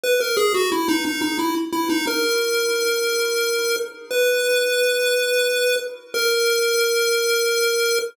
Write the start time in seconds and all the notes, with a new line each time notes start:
0.04 B4
0.20 A#4
0.37 G#4
0.54 F#4
0.72 E4
0.88 D#4
1.05 D#4
1.22 D#4
1.39 E4
1.72 E4
1.90 D#4
2.07 A#4
4.11 B4
6.14 A#4